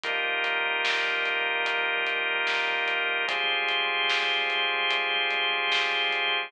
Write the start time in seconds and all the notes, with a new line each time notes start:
0.03 D#3 F3 G3 A#3 D#4 F4 G4 A#4, kick, closed hi-hat
0.44 closed hi-hat
0.85 snare
1.26 closed hi-hat
1.66 closed hi-hat
2.07 closed hi-hat
2.47 snare
2.88 closed hi-hat
3.28 F3 G3 G#3 C4 F4 G4 G#4 C5, kick, closed hi-hat
3.69 closed hi-hat
4.09 snare
4.50 closed hi-hat
4.91 closed hi-hat
5.31 closed hi-hat
5.72 snare
6.13 closed hi-hat